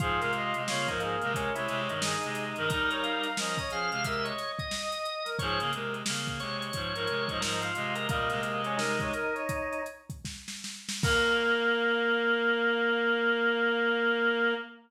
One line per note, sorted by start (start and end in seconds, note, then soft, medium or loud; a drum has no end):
0.00 0.20 G#2 medium
0.00 0.20 F3 medium
0.00 0.62 F4 loud
0.00 0.20 G#4 loud
0.00 kick medium
0.00 closed hi-hat medium
0.19 0.53 C3 medium
0.19 0.53 G#3 medium
0.19 0.31 A#4 medium
0.19 snare soft
0.19 closed hi-hat medium
0.33 0.55 D#5 medium
0.33 closed hi-hat medium
0.54 0.67 C3 medium
0.54 0.67 G#3 medium
0.54 0.69 D#5 medium
0.54 closed hi-hat medium
0.68 0.87 C#3 medium
0.68 0.87 A#3 medium
0.68 0.88 F4 loud
0.68 0.87 C#5 medium
0.68 snare medium
0.88 1.16 G#2 medium
0.88 1.16 F3 medium
0.88 1.00 D#4 loud
0.88 1.02 A#4 medium
0.88 kick medium
0.88 closed hi-hat medium
1.00 1.32 A#3 loud
1.00 1.21 G#4 medium
1.00 closed hi-hat medium
1.21 1.50 C3 medium
1.21 1.50 G#3 medium
1.21 1.33 A#4 medium
1.21 closed hi-hat medium
1.34 1.56 C#4 loud
1.34 1.54 A#4 medium
1.34 kick medium
1.34 closed hi-hat medium
1.55 1.68 C3 medium
1.55 1.68 G#3 medium
1.55 1.81 E4 medium
1.55 2.00 C#5 medium
1.55 closed hi-hat medium
1.68 1.88 C3 medium
1.68 1.88 G#3 medium
1.68 snare soft
1.68 closed hi-hat medium
1.89 2.15 G2 medium
1.89 2.15 D#3 medium
1.89 2.65 D#4 medium
1.89 closed hi-hat medium
2.02 2.45 G#4 medium
2.02 snare loud
2.23 2.54 C3 medium
2.23 2.54 G#3 medium
2.23 closed hi-hat medium
2.35 snare soft
2.35 closed hi-hat medium
2.56 2.69 G2 medium
2.56 2.69 D#3 medium
2.56 2.69 A#4 medium
2.56 closed hi-hat medium
2.68 3.27 G3 medium
2.68 3.27 D#4 medium
2.68 3.29 A#4 loud
2.68 2.89 A#4 loud
2.68 kick medium
2.68 closed hi-hat medium
2.90 3.03 C#5 medium
2.90 closed hi-hat medium
3.01 3.21 F5 medium
3.01 closed hi-hat medium
3.23 3.36 F5 medium
3.23 closed hi-hat medium
3.37 3.57 F3 medium
3.37 3.57 C#4 medium
3.37 3.58 A#4 medium
3.37 3.58 D#5 medium
3.37 snare medium
3.58 3.71 C#5 medium
3.58 3.70 D#5 loud
3.58 kick medium
3.58 closed hi-hat medium
3.70 3.90 F3 medium
3.70 3.90 C#4 medium
3.70 3.90 G#4 medium
3.70 4.04 F5 loud
3.70 closed hi-hat medium
3.91 4.32 C3 medium
3.91 4.32 G#3 medium
3.91 4.04 F5 medium
3.91 closed hi-hat medium
4.04 4.25 A#4 medium
4.04 4.25 E5 loud
4.04 kick medium
4.04 closed hi-hat medium
4.24 4.52 C#5 medium
4.24 4.67 D#5 medium
4.24 closed hi-hat medium
4.38 snare soft
4.38 closed hi-hat medium
4.59 5.30 D#5 loud
4.59 kick medium
4.59 closed hi-hat medium
4.71 5.15 D#5 medium
4.71 snare medium
4.92 closed hi-hat medium
5.05 closed hi-hat medium
5.25 5.37 A#4 medium
5.25 snare soft
5.25 closed hi-hat medium
5.39 5.59 G#2 medium
5.39 5.59 F3 medium
5.39 5.71 G#4 medium
5.39 5.59 C#5 loud
5.39 kick medium
5.39 closed hi-hat medium
5.60 5.72 C#3 medium
5.60 5.72 A#3 medium
5.60 closed hi-hat medium
5.73 6.03 C3 medium
5.73 6.03 G#3 medium
5.73 5.94 A#4 medium
5.73 closed hi-hat medium
5.94 closed hi-hat medium
6.06 6.39 C#3 medium
6.06 6.39 A#3 medium
6.06 snare loud
6.27 kick medium
6.27 closed hi-hat medium
6.40 6.71 C3 medium
6.40 6.71 G#3 medium
6.40 6.60 C#5 loud
6.40 snare soft
6.40 closed hi-hat medium
6.61 7.38 C#5 loud
6.61 closed hi-hat medium
6.73 6.93 G#2 medium
6.73 6.93 F3 medium
6.73 kick medium
6.73 closed hi-hat medium
6.95 7.07 G#2 medium
6.95 7.07 F3 medium
6.95 7.24 A#4 loud
6.95 closed hi-hat medium
7.07 7.28 C3 medium
7.07 7.28 G#3 medium
7.07 closed hi-hat medium
7.28 7.41 G#2 medium
7.28 7.41 F3 medium
7.28 7.40 D#5 medium
7.28 kick medium
7.28 closed hi-hat medium
7.41 7.71 G#2 medium
7.41 7.71 F3 medium
7.41 7.60 A#4 loud
7.41 7.61 D#5 medium
7.41 snare medium
7.60 7.94 F4 medium
7.60 7.73 F5 medium
7.60 closed hi-hat medium
7.75 8.07 C3 medium
7.75 8.07 G#3 medium
7.75 8.06 D#5 medium
7.75 closed hi-hat medium
7.96 8.08 A#4 loud
7.96 closed hi-hat medium
8.09 8.29 A#2 medium
8.09 8.29 G3 medium
8.09 8.41 A#3 loud
8.09 8.74 D#5 loud
8.09 kick medium
8.09 closed hi-hat medium
8.30 9.11 C3 medium
8.30 9.11 G#3 medium
8.30 snare soft
8.30 closed hi-hat medium
8.42 8.62 A#3 medium
8.42 closed hi-hat medium
8.64 8.79 C#4 loud
8.64 closed hi-hat medium
8.77 9.82 D#4 loud
8.77 8.98 A#4 medium
8.77 snare medium
9.00 9.13 C#5 medium
9.00 kick medium
9.00 closed hi-hat medium
9.13 9.34 A#4 loud
9.13 closed hi-hat medium
9.34 9.83 C#5 medium
9.34 closed hi-hat soft
9.49 kick medium
9.49 closed hi-hat medium
9.73 closed hi-hat medium
9.86 closed hi-hat medium
10.10 kick medium
10.10 closed hi-hat medium
10.25 kick medium
10.25 snare medium
10.48 snare medium
10.64 snare medium
10.89 snare medium
11.03 14.54 A#3 loud
11.03 14.55 A#3 loud
11.03 14.54 A#4 loud
11.03 kick loud
11.03 crash loud